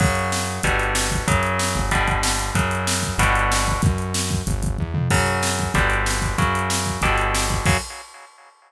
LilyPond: <<
  \new Staff \with { instrumentName = "Overdriven Guitar" } { \clef bass \time 4/4 \key fis \phrygian \tempo 4 = 188 <cis fis>2 <b, d g>2 | <cis fis>2 <b, d g>2 | <cis fis>2 <b, d g>2 | r1 |
<cis fis>2 <b, d g>2 | <cis fis>2 <b, d g>2 | <cis fis>4 r2. | }
  \new Staff \with { instrumentName = "Synth Bass 1" } { \clef bass \time 4/4 \key fis \phrygian fis,2 g,,2 | fis,4. g,,2~ g,,8 | fis,2 g,,2 | fis,2 g,,4 e,8 eis,8 |
fis,2 g,,2 | fis,2 g,,2 | fis,4 r2. | }
  \new DrumStaff \with { instrumentName = "Drums" } \drummode { \time 4/4 <cymc bd>8 hh8 sn8 hh8 <hh bd>8 hh8 sn8 <hh bd>8 | <hh bd>8 hh8 sn8 <hh bd>8 <hh bd>8 <hh bd>8 sn8 hh8 | <hh bd>8 hh8 sn8 <hh bd>8 <hh bd>8 hh8 sn8 <hh bd>8 | <hh bd>8 hh8 sn8 <hh bd>8 <hh bd>8 <hh bd>8 bd8 toml8 |
<cymc bd>8 hh8 sn8 <hh bd>8 <hh bd>8 hh8 sn8 <hh bd>8 | <hh bd>8 hh8 sn8 <hh bd>8 <hh bd>8 hh8 sn8 <hh bd>8 | <cymc bd>4 r4 r4 r4 | }
>>